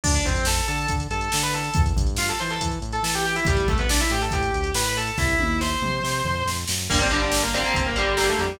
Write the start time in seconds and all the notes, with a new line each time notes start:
0.04 D2 D4 D5, kick, crash
0.14 D4 D5, closed hi-hat
0.25 F2 C4 C5, kick, closed hi-hat
0.36 closed hi-hat
0.45 A4 A5, snare
0.57 closed hi-hat
0.68 D3 A4 A5, closed hi-hat
0.78 closed hi-hat
0.88 D3, kick, closed hi-hat
1.00 closed hi-hat
1.11 G2 A4 A5, closed hi-hat
1.21 closed hi-hat
1.32 D3, snare
1.43 B4 B5, closed hi-hat
1.53 A4 A5, closed hi-hat
1.64 closed hi-hat
1.74 E2, kick, closed hi-hat
1.86 closed hi-hat
1.96 G2, kick, closed hi-hat
2.07 closed hi-hat
2.16 F4 F5, snare
2.28 A4 A5, closed hi-hat
2.39 E3 C5 C6, closed hi-hat
2.50 A4 A5, closed hi-hat
2.61 E3, kick, closed hi-hat
2.72 closed hi-hat
2.82 A2, closed hi-hat
2.92 A4 A5, closed hi-hat
3.03 E3 A4 A5, snare
3.13 G4 G5, closed hi-hat
3.25 G4 G5, closed hi-hat
3.36 E4 E5, closed hi-hat
3.45 A1 G3 G4, kick, closed hi-hat
3.57 closed hi-hat
3.68 C2 A3 A4, kick, closed hi-hat
3.78 B3 B4, closed hi-hat
3.89 D4 D5, snare
4.00 E4 E5, closed hi-hat
4.10 A2 G4 G5, closed hi-hat
4.21 A4 A5, closed hi-hat
4.31 A2 G4 G5, kick, closed hi-hat
4.42 closed hi-hat
4.54 D2, closed hi-hat
4.64 closed hi-hat
4.74 A2 B4 B5, snare
4.84 B4 B5, closed hi-hat
4.96 A4 A5, closed hi-hat
5.07 closed hi-hat
5.18 C2 E4 E5, kick, snare
5.39 D#2, high tom
5.61 C5 C6, snare
5.82 C3, mid tom
6.04 C3, snare
6.24 F2, floor tom
6.45 F2, snare
6.67 F#2, snare
6.89 G1 D3 G3 A#3 A#4, kick, crash
6.99 D3 G3 A#3 C4 C5
7.11 D3 G3 A#3 D4 D5, closed hi-hat
7.21 D4 D5
7.32 snare
7.43 A#3 A#4
7.53 D3 G3 A#3 C4 C5, closed hi-hat
7.64 D3 G3 A#3
7.74 G1 C4 C5, kick, closed hi-hat
7.86 A#3 A#4
7.96 G1 D3 G3 A#3 G4, closed hi-hat
8.17 D3 G3 A#3 G4, snare
8.28 A3 A4
8.39 F2 G3 G4, closed hi-hat